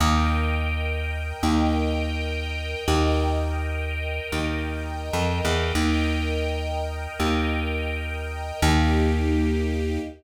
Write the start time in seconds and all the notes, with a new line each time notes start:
0.00 D#2 A#4 D#5 G5
1.43 D#2
2.88 D#2 A#4 D#5 G5
4.32 D#2
5.13 F2
5.45 E2
5.75 D#2 A#4 D#5 G5
7.20 D#2
8.62 D#2 A#3 D#4 G4